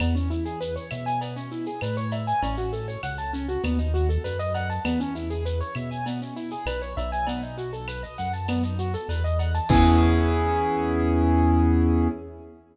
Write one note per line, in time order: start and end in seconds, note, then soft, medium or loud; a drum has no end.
0.00 0.78 E2 loud
0.00 0.14 B3 medium
0.00 cowbell medium
0.00 claves loud
0.00 shaker loud
0.15 0.29 C#4 medium
0.15 shaker medium
0.30 0.44 E4 medium
0.30 shaker medium
0.45 0.59 G#4 medium
0.45 shaker medium
0.60 0.74 B4 medium
0.60 tambourine medium
0.60 shaker loud
0.76 0.89 C#5 medium
0.76 shaker medium
0.91 1.69 B2 medium
0.91 1.05 E5 medium
0.91 claves medium
0.91 shaker medium
1.06 1.20 G#5 medium
1.06 shaker medium
1.21 1.35 B3 medium
1.21 cowbell medium
1.21 shaker medium
1.36 1.50 C#4 medium
1.36 shaker medium
1.51 1.65 E4 medium
1.51 shaker medium
1.66 1.80 G#4 medium
1.66 shaker medium
1.81 2.33 A2 medium
1.81 1.95 B4 medium
1.81 tambourine medium
1.81 cowbell medium
1.81 claves medium
1.81 shaker loud
1.97 2.11 C#5 medium
1.97 shaker medium
2.11 2.26 E5 medium
2.11 cowbell medium
2.11 shaker medium
2.27 2.41 G#5 medium
2.27 shaker medium
2.42 2.97 A1 loud
2.42 2.56 C#4 medium
2.42 cowbell medium
2.42 shaker medium
2.57 2.71 F#4 medium
2.57 shaker medium
2.72 2.86 A4 medium
2.72 shaker medium
2.88 3.02 C#5 medium
2.88 shaker medium
3.03 3.58 C#2 medium
3.03 3.17 F#5 medium
3.03 tambourine medium
3.03 claves medium
3.03 shaker medium
3.17 3.32 A5 medium
3.17 shaker medium
3.33 3.47 C#4 medium
3.33 shaker medium
3.48 3.62 F#4 medium
3.48 shaker medium
3.63 4.18 D#2 loud
3.63 3.77 B3 medium
3.63 cowbell medium
3.63 claves medium
3.63 shaker medium
3.78 3.92 D#4 medium
3.78 shaker medium
3.94 4.08 F#4 medium
3.94 shaker medium
4.09 4.23 A4 medium
4.09 shaker medium
4.24 4.79 F#2 medium
4.24 4.38 B4 medium
4.24 tambourine medium
4.24 cowbell medium
4.24 shaker medium
4.39 4.53 D#5 medium
4.39 shaker medium
4.54 4.68 F#5 medium
4.54 cowbell medium
4.54 shaker medium
4.70 4.83 A5 medium
4.70 shaker medium
4.85 5.62 E2 medium
4.85 4.98 B3 medium
4.85 cowbell medium
4.85 claves loud
4.85 shaker loud
5.00 5.14 C#4 medium
5.00 shaker medium
5.15 5.29 E4 medium
5.15 shaker medium
5.30 5.44 G#4 medium
5.30 shaker medium
5.45 5.59 B4 medium
5.45 tambourine medium
5.45 shaker loud
5.61 5.74 C#5 medium
5.61 shaker medium
5.75 6.53 B2 medium
5.75 5.89 E5 medium
5.75 claves medium
5.75 shaker medium
5.91 6.05 G#5 medium
5.91 shaker medium
6.06 6.20 B3 medium
6.06 cowbell medium
6.06 shaker loud
6.21 6.35 C#4 medium
6.21 shaker medium
6.36 6.50 E4 medium
6.36 shaker medium
6.51 6.65 G#4 medium
6.51 shaker medium
6.66 6.95 B1 medium
6.66 6.80 B4 medium
6.66 tambourine medium
6.66 cowbell medium
6.66 claves loud
6.66 shaker loud
6.82 6.95 C#5 medium
6.82 shaker medium
6.97 8.05 B1 loud
6.97 7.11 E5 medium
6.97 cowbell medium
6.97 shaker medium
7.12 7.26 G#5 medium
7.12 shaker medium
7.27 7.41 B3 medium
7.27 cowbell loud
7.27 shaker medium
7.42 7.56 D#4 medium
7.42 shaker medium
7.58 7.71 F#4 medium
7.58 shaker medium
7.73 7.86 A4 medium
7.73 shaker medium
7.88 8.02 B4 medium
7.88 tambourine medium
7.88 claves medium
7.88 shaker loud
8.03 8.17 D#5 medium
8.03 shaker medium
8.18 8.96 F#2 medium
8.18 8.32 F#5 medium
8.18 shaker medium
8.33 8.47 A5 medium
8.33 shaker medium
8.48 8.62 B3 medium
8.48 cowbell medium
8.48 claves medium
8.48 shaker loud
8.63 8.77 D#4 medium
8.63 shaker medium
8.78 8.92 F#4 medium
8.78 shaker medium
8.94 9.08 A4 medium
8.94 shaker medium
9.09 9.60 E2 medium
9.09 9.23 B4 medium
9.09 tambourine medium
9.09 cowbell medium
9.09 shaker loud
9.24 9.38 D#5 medium
9.24 shaker medium
9.39 9.53 F#5 medium
9.39 cowbell medium
9.39 shaker medium
9.54 9.68 A5 medium
9.54 shaker medium
9.69 12.08 E2 loud
9.69 12.08 B3 loud
9.69 12.08 C#4 loud
9.69 12.08 E4 loud
9.69 12.08 G#4 loud
9.69 kick loud
9.69 crash loud